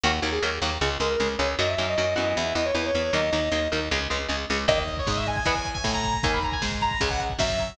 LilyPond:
<<
  \new Staff \with { instrumentName = "Lead 2 (sawtooth)" } { \time 4/4 \key dis \phrygian \tempo 4 = 155 r1 | r1 | r1 | dis''16 dis''8 cis''16 dis''16 e''16 gis''16 gis''4 gis''8 ais''8. |
gis''16 b''16 ais''16 gis''16 r8 ais''8 gis''16 fis''16 r8 e''4 | }
  \new Staff \with { instrumentName = "Distortion Guitar" } { \time 4/4 \key dis \phrygian fis''16 r8 gis'16 r4. ais'8. r16 cis''16 r16 | dis''16 e''8 dis''16 dis''8 dis''8 e''8 dis''16 cis''16 b'16 cis''8 cis''16 | dis''4. r2 r8 | r1 |
r1 | }
  \new Staff \with { instrumentName = "Overdriven Guitar" } { \time 4/4 \key dis \phrygian <dis fis ais>8 <dis fis ais>8 <dis fis ais>8 <dis fis ais>8 <cis gis>8 <cis gis>8 <cis gis>8 <cis gis>8 | <dis fis ais>8 <dis fis ais>8 <dis fis ais>8 <e b>4 <e b>8 <e b>8 <e b>8 | <dis fis ais>8 <dis fis ais>8 <dis fis ais>8 <dis fis ais>8 <cis gis>8 <cis gis>8 <cis gis>8 <cis gis>8 | <dis ais>8 r8 gis4 <e b>16 r8. a4 |
<dis ais>8 r8 gis4 <cis gis>16 r8. fis4 | }
  \new Staff \with { instrumentName = "Electric Bass (finger)" } { \clef bass \time 4/4 \key dis \phrygian dis,8 dis,8 dis,8 dis,8 cis,8 cis,8 cis,8 cis,8 | fis,8 fis,8 fis,8 fis,8 e,8 e,8 e,8 e,8 | dis,8 dis,8 dis,8 dis,8 cis,8 cis,8 cis,8 cis,8 | dis,4 gis,4 e,4 a,4 |
dis,4 gis,4 cis,4 fis,4 | }
  \new DrumStaff \with { instrumentName = "Drums" } \drummode { \time 4/4 r4 r4 r4 r4 | r4 r4 r4 r4 | r4 r4 r4 r4 | <cymc bd>16 bd16 <hh bd>16 bd16 <bd sn>16 bd16 <hh bd>16 bd16 <hh bd>16 bd16 <hh bd>16 bd16 <bd sn>16 bd16 <hh bd>16 bd16 |
<hh bd>16 bd16 <hh bd>16 bd16 <bd sn>16 bd16 <hh bd>16 bd16 <hh bd>16 bd16 <hh bd>16 bd16 <bd sn>16 bd16 <hh bd>16 bd16 | }
>>